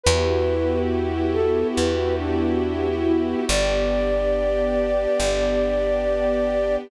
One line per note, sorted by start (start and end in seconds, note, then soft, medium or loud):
0.04 1.64 E2 medium
0.04 3.45 B3 medium
0.04 3.45 E4 loud
0.04 3.45 F#4 medium
0.04 3.45 G4 loud
0.04 0.79 B4 loud
1.33 1.68 A4 loud
1.76 3.35 E2 medium
1.76 2.15 B4 medium
2.18 2.88 D4 medium
3.06 3.41 E4 medium
3.48 5.07 G1 loud
3.48 6.88 B3 medium
3.48 6.88 D4 medium
3.48 6.88 G4 loud
3.48 6.76 D5 loud
5.20 6.77 G1 medium